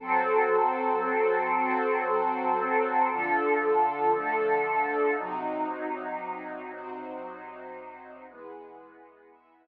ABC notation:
X:1
M:5/4
L:1/8
Q:1/4=58
K:Amix
V:1 name="Pad 2 (warm)"
[F,=CA]6 [D,=F,A]4 | [=C,_G,_E]6 [=E,^G,B,]4 |]
V:2 name="String Ensemble 1"
[FA=c]3 [=CFc]3 [D=FA]2 [A,DA]2 | [=C_E_G]3 [CG=c]3 [=E^GB]2 [EBe]2 |]